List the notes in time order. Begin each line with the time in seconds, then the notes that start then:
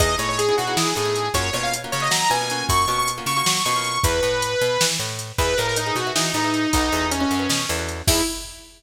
0.00 E2 B3 D#4 E4 G#4 D#5, kick, closed hi-hat
0.18 A2 B3 D#4 E4 G#4 C#5, closed hi-hat
0.29 C#5
0.39 G#4, closed hi-hat
0.49 B3 D#4 E4 G#4
0.58 B2 F#4, closed hi-hat
0.67 B3 D#4 E4 G#4
0.77 E3 G#4, snare
0.95 A2 B3 D#4 E4 G#4, closed hi-hat
1.05 B3 D#4 E4 G#4
1.16 closed hi-hat
1.34 F#2 A#3 C#4 F4 F#4 C#5, kick, closed hi-hat
1.53 B2 A#3 C#4 F4 F#4 C#5, closed hi-hat
1.63 F5
1.73 closed hi-hat
1.84 A#3 C#4 F4 F#4
1.92 C#3 C#5, closed hi-hat
2.00 A#3 C#4 F4 F#4 D#5
2.11 F#3 A#5, snare
2.29 B2 A#3 C#4 F4 F#4 G#5, closed hi-hat
2.41 A#3 C#4 F4 F#4
2.50 A#3 C#4 F4 F#4, closed hi-hat
2.69 F#2 C#6, kick, closed hi-hat
2.88 B2 A#3 C#4 F4 F#4 C#6, closed hi-hat
2.98 C#6
3.08 closed hi-hat
3.18 A#3 C#4 F4 F#4
3.26 C#3 C#6, closed hi-hat
3.36 A#3 C#4 F4 F#4 C#6
3.46 F#3 C#6, snare
3.65 B2 A#3 C#4 F4 F#4 C#6, closed hi-hat
3.76 A#3 C#4 F4 F#4
3.84 closed hi-hat
4.04 E2 B4, kick, closed hi-hat
4.23 A2, closed hi-hat
4.42 closed hi-hat
4.61 B2, closed hi-hat
4.81 E3, snare
4.99 A2, closed hi-hat
5.19 closed hi-hat
5.38 E2 G#4 B4 D#5 E5, kick, closed hi-hat
5.57 A2 G#4 A#4 B4 D#5 E5, closed hi-hat
5.67 A#4
5.76 D#4, closed hi-hat
5.86 G#4 B4 D#5 E5
5.95 B2 F#4, closed hi-hat
6.07 G#4 B4 D#5 E5
6.16 E3 D#4, snare
6.34 A2 D#4 G#4 B4 D#5 E5, closed hi-hat
6.44 G#4 B4 D#5 E5
6.54 closed hi-hat
6.73 B1 D#4 F#4 A4 B4 D#5, kick, closed hi-hat
6.92 E2 F#4 A4 B4 D#5, closed hi-hat
7.11 C#4, closed hi-hat
7.20 C#4 F#4 A4 B4 D#5
7.31 F#2, closed hi-hat
7.39 F#4 A4 B4 D#5
7.49 B2, snare
7.69 E2 F#4 A4 B4 D#5, closed hi-hat
7.79 F#4 A4 B4 D#5
7.89 closed hi-hat
8.07 E2 B3 D#4 E4 G#4, kick, crash